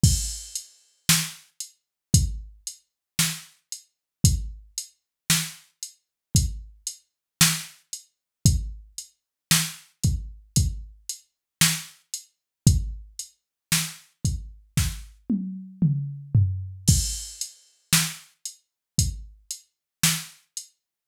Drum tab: CC |x-------|--------|--------|--------|
HH |-x-xxx-x|xx-xxx-x|xx-xxx-x|xx-x----|
SD |--o---o-|--o---o-|--o---o-|--o-o---|
T1 |--------|--------|--------|-----o--|
T2 |--------|--------|--------|------o-|
FT |--------|--------|--------|-------o|
BD |o---o---|o---o---|o--oo---|o--oo---|

CC |x-------|
HH |-x-xxx-x|
SD |--o---o-|
T1 |--------|
T2 |--------|
FT |--------|
BD |o---o---|